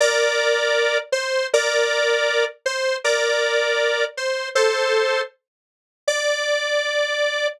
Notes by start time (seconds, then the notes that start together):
0.00 A#4 D5
1.12 C5
1.53 A#4 D5
2.66 C5
3.04 A#4 D5
4.17 C5
4.55 A4 C5
6.08 D5